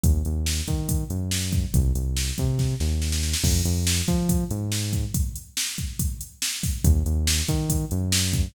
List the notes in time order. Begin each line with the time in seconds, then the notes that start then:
0.04 D#2, kick, closed hi-hat
0.25 D#2, closed hi-hat
0.46 snare
0.68 D#3, kick, closed hi-hat
0.89 kick, closed hi-hat
1.10 F#2, closed hi-hat
1.31 snare
1.53 kick, closed hi-hat
1.74 C2, kick, closed hi-hat
1.95 C2, closed hi-hat
2.17 snare
2.38 C3, kick, closed hi-hat
2.59 kick, snare
2.80 D#2, snare
3.02 snare
3.12 snare
3.23 snare
3.34 snare
3.44 F2, kick, crash
3.65 F2, closed hi-hat
3.87 snare
4.08 F3, kick, closed hi-hat
4.29 kick, closed hi-hat
4.50 G#2, closed hi-hat
4.72 snare
4.93 kick, closed hi-hat
5.14 kick, closed hi-hat
5.36 closed hi-hat
5.57 snare
5.78 kick, closed hi-hat
5.99 kick, closed hi-hat
6.21 closed hi-hat
6.42 snare
6.63 kick, open hi-hat
6.84 D#2, kick, closed hi-hat
7.06 D#2, closed hi-hat
7.27 snare
7.48 D#3, kick, closed hi-hat
7.70 kick, closed hi-hat
7.91 F#2, closed hi-hat
8.12 snare
8.33 kick, closed hi-hat